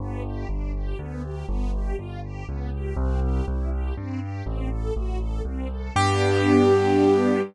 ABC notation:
X:1
M:3/4
L:1/8
Q:1/4=121
K:G
V:1 name="Acoustic Grand Piano"
z6 | z6 | z6 | z6 |
G6 |]
V:2 name="String Ensemble 1"
B, G D G B, G | B, G =F G B, G | C G E G C G | C A F A C A |
[B,DG]6 |]
V:3 name="Acoustic Grand Piano" clef=bass
G,,,2 G,,,2 D,,2 | G,,,2 G,,,2 ^C,,2 | C,,2 C,,2 G,,2 | A,,,2 A,,,2 C,,2 |
G,,6 |]